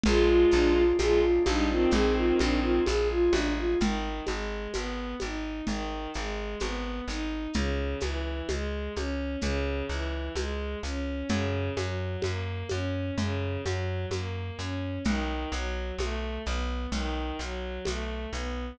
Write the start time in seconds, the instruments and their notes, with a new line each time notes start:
0.04 electric bass (finger) A#1, violin G#3 F4, drawbar organ G#3 A#3 D4 F4, flute G#4, low conga, shaker
0.28 flute F4
0.51 electric bass (finger) A#1, flute D4, shaker
0.76 flute F4
0.99 electric bass (finger) A#1, violin G#3 F4, flute G#4, high conga, shaker
1.21 flute F4
1.45 electric bass (finger) A#1, violin G3 D#4, flute D4, high conga, shaker
1.69 violin D#3 C4, flute F4
1.91 electric bass (finger) A#1, drawbar organ G#3 A#3 F4 G#4, flute G#4, low conga, shaker
2.16 flute F4
2.39 electric bass (finger) A#1, flute D4, high conga, shaker
2.62 flute F4
2.86 electric bass (finger) A#1, flute G#4, high conga, shaker
3.11 flute F4
3.32 electric bass (finger) A1, flute D4, high conga, shaker
3.57 flute F4
3.80 electric bass (finger) G#1, violin D#3, low conga, shaker
4.26 electric bass (finger) G#1, violin G#3, high conga, shaker
4.73 electric bass (finger) G#1, violin B3, high conga, shaker
5.20 electric bass (finger) G#1, violin D#4, high conga, shaker
5.67 electric bass (finger) G#1, violin D#3, low conga, shaker
6.14 electric bass (finger) G#1, violin G#3, shaker
6.60 electric bass (finger) G#1, violin B3, high conga, shaker
7.07 electric bass (finger) G#1, violin D#4, shaker
7.54 electric bass (finger) C#2, violin C#3, low conga, shaker
8.00 electric bass (finger) C#2, violin E3, high conga, shaker
8.49 electric bass (finger) C#2, violin G#3, high conga, shaker
8.95 electric bass (finger) C#2, violin C#4, high conga, shaker
9.41 electric bass (finger) C#2, violin C#3, low conga, shaker
9.89 electric bass (finger) C#2, violin E3, shaker
10.35 electric bass (finger) C#2, violin G#3, high conga, shaker
10.83 electric bass (finger) C#2, violin C#4, shaker
11.29 electric bass (finger) F#2, violin C#3, low conga, shaker
11.77 electric bass (finger) F#2, violin F#3, high conga, shaker
12.22 electric bass (finger) F#2, violin A#3, high conga, shaker
12.69 electric bass (finger) F#2, violin C#4, high conga, shaker
13.18 electric bass (finger) F#2, violin C#3, low conga, shaker
13.63 electric bass (finger) F#2, violin F#3, high conga, shaker
14.11 electric bass (finger) F#2, violin A#3, high conga, shaker
14.59 electric bass (finger) F#2, violin C#4, shaker
15.04 electric bass (finger) B1, violin D#3, low conga, shaker
15.52 electric bass (finger) B1, violin F#3, shaker
15.98 electric bass (finger) B1, violin A3, high conga, shaker
16.46 electric bass (finger) B1, violin B3, shaker
16.92 electric bass (finger) B1, violin D#3, low conga, shaker
17.39 electric bass (finger) B1, violin F#3, shaker
17.85 electric bass (finger) B1, violin A3, high conga, shaker
18.33 electric bass (finger) B1, violin B3, shaker